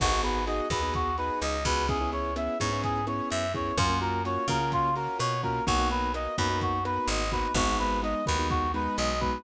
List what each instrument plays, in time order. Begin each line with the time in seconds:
0.00 electric bass (finger) G#1, acoustic grand piano B3 D#4 F#4 G#4, clarinet F#4, kick, cross-stick, crash
0.12 acoustic grand piano B3 D#4 F#4 G#4
0.23 acoustic grand piano B3 D#4 F#4 G#4, clarinet B4, closed hi-hat
0.47 acoustic grand piano B3 D#4 F#4 G#4, clarinet D#5, closed hi-hat
0.70 electric bass (finger) D#2, acoustic grand piano B3 D#4 F#4 G#4, clarinet B4, kick, cross-stick, closed hi-hat
0.82 acoustic grand piano B3 D#4 F#4 G#4
0.94 clarinet F#4, kick, closed hi-hat
1.18 acoustic grand piano B3 D#4 F#4 G#4, clarinet B4, closed hi-hat
1.41 electric bass (finger) C#2, clarinet D#5, cross-stick, closed hi-hat
1.65 electric bass (finger) C#2, acoustic grand piano B3 D#4 F#4 G#4, clarinet B4, kick, closed hi-hat
1.88 acoustic grand piano B3 C#4 E4 G#4, clarinet G#4, kick, closed hi-hat
2.01 acoustic grand piano B3 C#4 E4 G#4
2.12 acoustic grand piano B3 C#4 E4 G#4, clarinet C#5, closed hi-hat
2.36 acoustic grand piano B3 C#4 E4 G#4, clarinet E5, cross-stick, closed hi-hat
2.60 electric bass (finger) G#2, acoustic grand piano B3 C#4 E4 G#4, clarinet C#5, kick, closed hi-hat
2.72 acoustic grand piano B3 C#4 E4 G#4
2.84 clarinet G#4, kick, closed hi-hat
3.07 acoustic grand piano B3 C#4 E4 G#4, clarinet C#5, cross-stick, closed hi-hat
3.30 electric bass (finger) F#2, clarinet E5, closed hi-hat
3.54 acoustic grand piano B3 C#4 E4 G#4, clarinet C#5, kick, closed hi-hat
3.77 electric bass (finger) F#2, acoustic grand piano A#3 C#4 F4 F#4, clarinet F4, kick, cross-stick, closed hi-hat
3.90 acoustic grand piano A#3 C#4 F4 F#4
4.01 acoustic grand piano A#3 C#4 F4 F#4, clarinet A#4, closed hi-hat
4.25 acoustic grand piano A#3 C#4 F4 F#4, clarinet C#5, closed hi-hat
4.48 electric bass (finger) C#3, acoustic grand piano A#3 C#4 F4 F#4, clarinet A#4, kick, cross-stick, closed hi-hat
4.61 acoustic grand piano A#3 C#4 F4 F#4
4.72 clarinet F4, kick, closed hi-hat
4.96 acoustic grand piano A#3 C#4 F4 F#4, clarinet A#4, closed hi-hat
5.19 electric bass (finger) B2, clarinet C#5, cross-stick, closed hi-hat
5.43 acoustic grand piano A#3 C#4 F4 F#4, clarinet A#4, kick, closed hi-hat
5.67 electric bass (finger) B1, acoustic grand piano A#3 B3 D#4 F#4, clarinet F#4, kick, closed hi-hat
5.79 acoustic grand piano A#3 B3 D#4 F#4
5.90 acoustic grand piano A#3 B3 D#4 F#4, clarinet B4, closed hi-hat
6.14 acoustic grand piano A#3 B3 D#4 F#4, clarinet D#5, cross-stick, closed hi-hat
6.38 electric bass (finger) F#2, acoustic grand piano A#3 B3 D#4 F#4, clarinet B4, kick, closed hi-hat
6.50 acoustic grand piano A#3 B3 D#4 F#4
6.61 clarinet F#4, kick, closed hi-hat
6.85 acoustic grand piano A#3 B3 D#4 F#4, clarinet B4, cross-stick, closed hi-hat
7.08 electric bass (finger) G#1, clarinet D#5, closed hi-hat
7.32 acoustic grand piano A#3 B3 D#4 F#4, clarinet B4, kick, closed hi-hat
7.54 electric bass (finger) G#1, acoustic grand piano G#3 B3 D#4 F#4, clarinet F#4, kick, cross-stick, closed hi-hat
7.68 acoustic grand piano G#3 B3 D#4 F#4
7.79 acoustic grand piano G#3 B3 D#4 F#4, clarinet B4, closed hi-hat
8.03 acoustic grand piano G#3 B3 D#4 F#4, clarinet D#5, closed hi-hat
8.26 electric bass (finger) D#2, acoustic grand piano G#3 B3 D#4 F#4, clarinet B4, kick, cross-stick, closed hi-hat
8.39 acoustic grand piano G#3 B3 D#4 F#4
8.50 clarinet F#4, kick, closed hi-hat
8.74 acoustic grand piano G#3 B3 D#4 F#4, clarinet B4, closed hi-hat
8.98 electric bass (finger) B1, clarinet D#5, cross-stick, closed hi-hat
9.21 acoustic grand piano G#3 B3 D#4 F#4, clarinet B4, kick, closed hi-hat